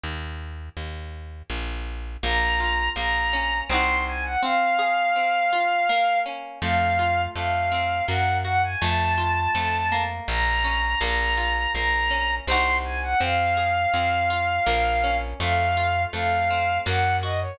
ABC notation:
X:1
M:3/4
L:1/16
Q:1/4=82
K:Bbm
V:1 name="Violin"
z12 | b4 b4 c'2 a g | f12 | f4 f4 g2 g a |
=a8 b4 | b4 b4 c'2 a g | f12 | f4 f4 g2 e d |]
V:2 name="Acoustic Guitar (steel)"
z12 | B,2 F2 B,2 D2 [CEG]4 | C2 A2 C2 F2 B,2 D2 | =A,2 F2 A,2 C2 B,2 G2 |
=A,2 F2 A,2 B,4 D2 | B,2 F2 B,2 D2 [CEG]4 | C2 A2 C2 F2 B,2 D2 | =A,2 F2 A,2 C2 B,2 G2 |]
V:3 name="Electric Bass (finger)" clef=bass
E,,4 E,,4 B,,,4 | B,,,4 B,,,4 C,,4 | z12 | F,,4 F,,4 G,,4 |
F,,4 F,,4 B,,,4 | B,,,4 B,,,4 C,,4 | F,,4 F,,4 B,,,4 | F,,4 F,,4 G,,4 |]